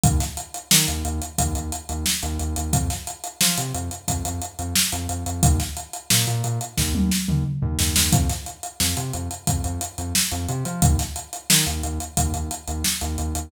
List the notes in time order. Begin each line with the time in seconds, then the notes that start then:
0.04 D#2, kick, closed hi-hat
0.20 snare, closed hi-hat
0.37 closed hi-hat
0.54 closed hi-hat
0.71 D#3, snare
0.88 D#2, closed hi-hat
1.05 D#2, closed hi-hat
1.22 closed hi-hat
1.38 D#2, kick, closed hi-hat
1.55 D#2, closed hi-hat
1.72 closed hi-hat
1.89 D#2, closed hi-hat
2.06 snare
2.23 D#2, closed hi-hat
2.39 D#2, closed hi-hat
2.56 D#2, closed hi-hat
2.73 F2, kick, closed hi-hat
2.90 snare, closed hi-hat
3.07 closed hi-hat
3.24 closed hi-hat
3.41 F3, snare
3.58 C3, closed hi-hat
3.74 F2, closed hi-hat
3.91 closed hi-hat
4.08 F2, kick, closed hi-hat
4.25 F2, closed hi-hat
4.42 closed hi-hat
4.59 F2, closed hi-hat
4.75 snare
4.92 F2, closed hi-hat
5.09 F2, closed hi-hat
5.26 F2, closed hi-hat
5.43 D#2, kick, closed hi-hat
5.60 snare, closed hi-hat
5.77 closed hi-hat
5.93 closed hi-hat
6.10 A#2, snare
6.27 A#2, closed hi-hat
6.44 A#2, closed hi-hat
6.61 closed hi-hat
6.77 D#2, kick, snare
6.95 D#2, high tom
7.11 snare
7.28 D#2, mid tom
7.62 D#2, floor tom
7.79 D#2, snare
7.96 D#2, snare
8.12 F2, kick, closed hi-hat
8.29 snare, closed hi-hat
8.46 closed hi-hat
8.63 closed hi-hat
8.80 F2, snare
8.97 C3, closed hi-hat
9.13 F2, closed hi-hat
9.31 closed hi-hat
9.47 F2, kick, closed hi-hat
9.64 F2, closed hi-hat
9.81 closed hi-hat
9.98 F2, closed hi-hat
10.15 snare
10.31 F2, closed hi-hat
10.48 C3, closed hi-hat
10.65 F3, closed hi-hat
10.82 D#2, kick, closed hi-hat
10.99 snare, closed hi-hat
11.16 closed hi-hat
11.33 closed hi-hat
11.50 D#3, snare
11.66 D#2, closed hi-hat
11.83 D#2, closed hi-hat
12.00 closed hi-hat
12.17 D#2, kick, closed hi-hat
12.34 D#2, closed hi-hat
12.51 closed hi-hat
12.68 D#2, closed hi-hat
12.84 snare
13.01 D#2, closed hi-hat
13.18 D#2, closed hi-hat
13.35 D#2, closed hi-hat